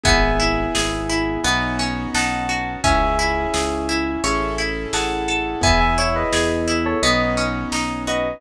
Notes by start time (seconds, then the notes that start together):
0.03 G#1 B3 E4 G#4 E5 G#5, kick, closed hi-hat
0.40 E4, closed hi-hat
0.75 G#1 G#4, snare
1.09 E4, closed hi-hat
1.44 B1 B3 C#4 D#4 F#4, closed hi-hat
1.79 C#4, closed hi-hat
2.14 B1 D#4 F#5 A5, snare
2.49 F#4, closed hi-hat
2.84 C#2 C#4 E4 G#4 E5 G#5, kick, closed hi-hat
3.19 E4, closed hi-hat
3.54 C#2 G#4, snare
3.89 E4, closed hi-hat
4.24 A1 C#4 E4 G#4 A4, closed hi-hat
4.58 E4, closed hi-hat
4.93 A1 G#4 F#5 A5, snare
5.28 A4, closed hi-hat
5.61 E2 B3 E4 G#4 E5 G#5, kick, closed hi-hat
5.80 E5 G#5
5.98 E4 C#5 E5, closed hi-hat
6.16 B4 D#5
6.32 E2 G#4, snare
6.68 E4, closed hi-hat
6.85 A4 C#5
7.02 B1 B3 C#4 D#4 F#4 B4 D#5, closed hi-hat
7.37 C#4, closed hi-hat
7.72 B1 D#4, snare
8.07 F#4 B4 D#5, closed hi-hat